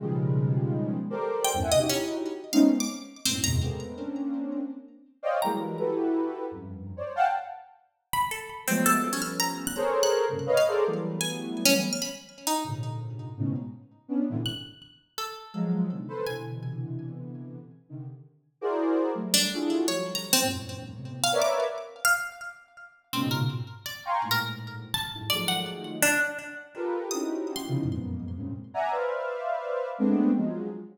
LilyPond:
<<
  \new Staff \with { instrumentName = "Ocarina" } { \time 5/4 \tempo 4 = 166 <b, des ees f g aes>2. <g' a' bes' c'' d''>4~ <g' a' bes' c'' d''>16 <e, ges, g, a,>16 <e'' ges'' aes''>16 <b, c des d>16 | <ees' e' ges' g'>4. r8 <aes a b c' des' ees'>8 r4. <ges, aes, a, b,>8 <e, ges, aes, a, b, c>8 | <aes a bes b c'>4 <bes c' des' d'>2 r4. <c'' des'' d'' ees'' f'' g''>8 | <e ges g aes bes>4 <e' ges' g' a' b'>2 <f, ges, g,>4~ <f, ges, g,>16 <c'' des'' d''>8 <f'' ges'' g'' a''>16 |
r1 <f ges aes a b>4 | <f g a b des'>2 <aes' a' bes' c'' des''>4. <g, aes, bes, c des>8 <b' des'' ees'' f''>8 <aes' a' bes' c'' d''>8 | <e ges g a b>2. r2 | <aes, bes, c d>2 <aes, a, b, des>8 r4. <b des' d'>8 <aes, bes, c d e>16 r16 |
r2. <f ges aes>4 <b, c d ees>8 <a' b' c''>8 | <b, c d e>1 r8 <c d ees>8 | r4. <e' ges' aes' bes' c'' d''>4. <ges g a>4 <d' e' f' ges' aes' a'>4 | <f ges g a>4. <e, ges, g, aes, bes,>4. <a, b, c>4 <bes' b' des'' d'' e''>4 |
r1 <aes, bes, b, des>4 | r4. <f'' g'' aes'' bes'' c''' des'''>8 <aes, a, bes,>2 r8 <ges, g, aes, a,>8 | <ees f ges aes a>2 r2 <f' g' a' bes' b'>4 | <c' des' ees' e' ges' g'>4. <b, c des ees e f>8 <f, ges, aes, bes, b,>4. <g, aes, bes, c des>8 r8 <d'' e'' ges'' aes'' bes''>8 |
<b' c'' d'' e'' f''>2. <aes a b c' d'>4 <f ges aes>4 | }
  \new Staff \with { instrumentName = "Pizzicato Strings" } { \time 5/4 r1 g''8. ees''16 | r16 des'16 r4. f''8. d'''16 r4 c'16 r16 bes''16 r16 | r1 r4 | bes''2 r2. |
r2 r8 b''8 a'4 c'8 a'8 | r16 des'16 f'''8 bes''16 r8 ges'''8 r8 ges'''16 r4 r16 f''16 r8 | r4 aes''4 r16 des'16 r8 f'''16 b''16 r4 ees'8 | r1 r4 |
ges'''2 a'2 r4 | aes''4. r2. r8 | r2. r8 d'8 r4 | des''8. bes''8 c'16 r2 r16 f''16 r16 d'''8. |
r4 f''16 r2 r8. c'16 r16 bes'16 r16 | r4 d''4 r16 bes'16 r4. a''8 r8 | d''8 ges''8 r4 d'8 r2 r8 | ees'''4 r16 c'''16 r2. r8 |
r1 r4 | }
>>